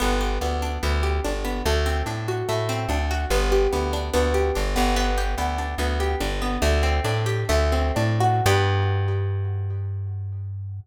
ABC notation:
X:1
M:4/4
L:1/8
Q:1/4=145
K:G
V:1 name="Harpsichord"
B, G B, D B, G D B, | A, C D F A, C D F | B, G B, D B, G D B, | B, G B, D B, G D B, |
"^rit." A, C D G A, C D F | [B,DG]8 |]
V:2 name="Electric Bass (finger)" clef=bass
G,,,2 D,,2 D,,2 G,,,2 | D,,2 A,,2 A,,2 D,,2 | G,,,2 D,,2 D,,2 G,,, G,,,- | G,,,2 D,,2 D,,2 G,,,2 |
"^rit." D,,2 A,,2 D,,2 A,,2 | G,,8 |]